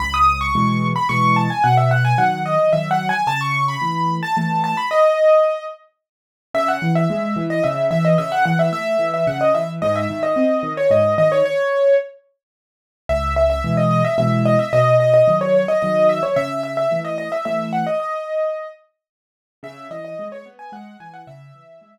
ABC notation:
X:1
M:3/4
L:1/16
Q:1/4=110
K:C#m
V:1 name="Acoustic Grand Piano"
b d'2 c'4 b c'2 a g | f e f g f2 d2 (3e2 f2 g2 | a c'2 b4 a a2 a b | d6 z6 |
e f2 e4 d e2 e d | e f f e e3 e f d e z | d e2 d4 c d2 d c | c4 z8 |
e2 e e2 d d e e2 d e | d2 d d2 c c d d2 e c | e2 e e2 d d e e2 f d | d6 z6 |
e2 d d2 c z g f2 g f | e6 z6 |]
V:2 name="Acoustic Grand Piano"
C,,4 [B,,E,G,]4 [B,,E,G,]4 | B,,4 [D,F,]4 [D,F,]4 | C,4 [E,A,]4 [E,A,]4 | z12 |
C,2 E,2 G,2 E,2 C,2 E,2 | C,2 E,2 A,2 E,2 C,2 E,2 | G,,2 D,2 ^B,2 D,2 G,,2 D,2 | z12 |
C,,4 [B,,E,G,]4 [B,,E,G,]4 | B,,4 [D,F,]4 [D,F,]4 | C,4 [E,A,]4 [E,A,]4 | z12 |
C,2 E,2 G,2 B,2 G,2 E,2 | C,2 E,2 G,2 z6 |]